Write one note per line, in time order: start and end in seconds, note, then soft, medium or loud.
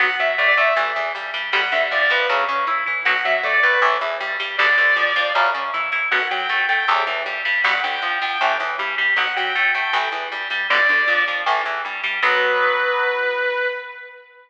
0.00 0.16 B1 medium
0.00 0.07 F#3 medium
0.00 0.07 B3 medium
0.00 0.17 F#5 loud
0.19 0.36 F#2 medium
0.19 0.35 F#3 medium
0.19 0.29 E5 loud
0.38 0.55 A2 medium
0.38 0.54 A3 medium
0.38 0.47 D5 medium
0.48 0.57 D5 medium
0.57 0.74 A2 medium
0.57 0.74 A3 medium
0.57 0.75 E5 loud
0.76 0.93 A1 medium
0.76 0.92 E3 medium
0.76 0.92 A3 medium
0.96 1.12 E2 medium
0.96 1.12 E3 medium
1.15 1.32 G2 medium
1.15 1.31 G3 medium
1.34 1.50 G2 medium
1.34 1.50 G3 medium
1.53 1.69 G1 medium
1.53 1.61 D3 medium
1.53 1.61 G3 loud
1.53 1.61 B3 medium
1.53 1.71 F#5 loud
1.72 1.88 D2 medium
1.72 1.88 D3 medium
1.72 1.81 E5 medium
1.91 2.08 F2 medium
1.91 2.07 F3 medium
1.91 2.01 D5 loud
2.02 2.11 D5 medium
2.10 2.26 F2 medium
2.10 2.27 F3 medium
2.10 2.26 B4 loud
2.29 2.46 F#2 medium
2.29 2.45 C#3 loud
2.29 2.45 F#3 medium
2.48 2.65 C#3 medium
2.48 2.65 C#4 medium
2.67 2.83 E3 medium
2.67 2.84 E4 medium
2.86 3.04 E3 medium
2.86 3.03 E4 medium
3.05 3.22 B1 medium
3.05 3.14 B2 medium
3.05 3.14 F#3 medium
3.05 3.23 F#5 loud
3.25 3.41 F#2 medium
3.25 3.41 F#3 medium
3.25 3.34 E5 loud
3.43 3.59 A2 medium
3.43 3.60 A3 medium
3.43 3.53 D5 medium
3.53 3.62 D5 medium
3.63 3.80 A2 medium
3.63 3.79 A3 medium
3.63 3.81 B4 loud
3.82 3.98 A1 medium
3.82 3.97 A2 medium
3.82 3.97 E3 medium
4.01 4.17 E2 medium
4.01 4.18 E3 medium
4.20 4.37 G2 medium
4.20 4.37 G3 medium
4.40 4.56 G2 medium
4.40 4.56 G3 medium
4.58 4.76 G1 medium
4.58 4.67 G2 medium
4.58 4.67 B2 medium
4.58 4.67 D3 medium
4.58 5.30 D5 loud
4.78 4.94 D2 medium
4.78 4.94 D3 medium
4.96 5.12 F2 medium
4.96 5.13 F3 medium
5.16 5.32 F2 medium
5.16 5.32 F3 medium
5.35 5.50 F#2 loud
5.35 5.51 F#2 medium
5.35 5.50 C#3 medium
5.54 5.71 C#3 medium
5.54 5.70 C#4 medium
5.74 5.90 E3 medium
5.74 5.90 E4 medium
5.92 6.08 E3 medium
5.92 6.09 E4 medium
6.11 6.28 B1 medium
6.11 6.19 F#2 medium
6.11 6.19 B2 medium
6.11 6.27 F#5 loud
6.31 6.47 F#2 medium
6.31 6.47 F#3 medium
6.31 6.59 G5 loud
6.49 6.65 A2 medium
6.49 6.66 A3 medium
6.69 6.85 A2 medium
6.69 6.85 A3 medium
6.69 6.86 G5 medium
6.88 7.04 A1 medium
6.88 7.03 E2 medium
6.88 7.03 A2 medium
7.07 7.23 E2 medium
7.07 7.23 E3 medium
7.26 7.42 G2 medium
7.26 7.42 G3 medium
7.45 7.62 G2 medium
7.45 7.61 G3 medium
7.64 7.80 G1 medium
7.64 7.72 G2 medium
7.64 7.72 B2 medium
7.64 7.72 D3 medium
7.64 7.80 F#5 loud
7.83 8.00 D2 medium
7.83 8.00 D3 medium
7.83 8.08 G5 medium
8.02 8.18 F2 medium
8.02 8.19 F3 medium
8.21 8.38 F2 medium
8.21 8.38 F3 medium
8.21 8.41 G5 loud
8.41 8.58 A1 medium
8.41 8.56 A2 medium
8.41 8.56 E3 medium
8.60 8.76 E2 medium
8.60 8.76 E3 medium
8.79 8.96 G2 medium
8.79 8.95 G3 medium
8.98 9.14 G2 medium
8.98 9.14 G3 medium
9.16 9.33 B1 medium
9.16 9.25 B2 medium
9.16 9.25 F#3 medium
9.16 9.34 F#5 loud
9.36 9.53 F#2 medium
9.36 9.53 F#3 medium
9.36 9.63 G5 loud
9.55 9.72 A2 medium
9.55 9.72 A3 medium
9.75 9.91 A2 medium
9.75 9.91 A3 medium
9.75 9.93 G5 loud
9.93 10.09 A1 loud
9.93 10.09 A2 medium
9.93 10.09 E3 medium
10.12 10.28 E2 medium
10.12 10.29 E3 medium
10.32 10.48 G2 medium
10.32 10.48 G3 medium
10.50 10.66 G2 medium
10.50 10.67 G3 medium
10.70 10.87 G1 medium
10.70 10.78 G2 medium
10.70 10.78 B2 loud
10.70 10.78 D3 medium
10.70 11.22 D5 loud
10.88 11.05 D2 medium
10.88 11.05 D3 medium
11.07 11.24 F2 medium
11.07 11.25 F3 medium
11.27 11.44 F2 medium
11.27 11.44 F3 medium
11.46 11.64 A1 medium
11.46 11.62 A2 medium
11.46 11.62 E3 medium
11.65 11.82 E2 medium
11.65 11.82 E3 medium
11.85 12.02 G2 medium
11.85 12.01 G3 medium
12.03 12.20 G2 medium
12.03 12.20 G3 medium
12.23 13.67 B1 loud
12.23 13.67 F#3 medium
12.23 13.67 B3 medium
12.23 13.67 B4 loud